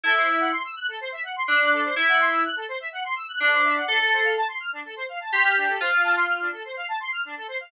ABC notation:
X:1
M:4/4
L:1/16
Q:1/4=125
K:Am
V:1 name="Electric Piano 2"
E4 z8 D4 | E4 z8 D4 | A4 z8 G4 | F6 z10 |]
V:2 name="Lead 1 (square)"
A c e ^f c' e' ^f' A c e f c' e' f' A c | e ^f c' e' ^f' A c e f c' e' f' A c e f | D A c f a c' f' D A c f a c' f' D A | c f a c' f' D A c f a c' f' D A c f |]